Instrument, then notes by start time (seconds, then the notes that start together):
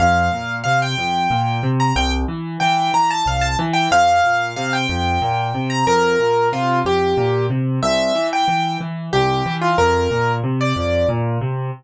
acoustic grand piano
0.00 F2 F5
0.33 A#2
0.64 C3 F5
0.82 G5
0.98 F2
1.30 A#2
1.63 C3
1.80 A#5
1.96 C2 G5
2.28 E3
2.60 E3 G5
2.93 E3 A#5
3.11 A5
3.26 C2 F5
3.41 A5
3.59 E3
3.73 G5
3.91 F2 F5
4.24 A#2
4.56 C3 F5
4.73 G5
4.89 F2
5.22 A#2
5.54 C3
5.70 A#5
5.87 F2 A#4
6.20 A#2
6.52 C3 F4
6.85 F2 G4
7.17 A#2
7.50 C3
7.83 C2 E5
8.15 E3
8.33 G5
8.48 E3
8.80 E3
9.13 C2 G4
9.46 E3
9.61 F4
9.78 F2 A#4
10.11 A#2
10.43 C3
10.61 D5
10.76 F2
11.09 A#2
11.41 C3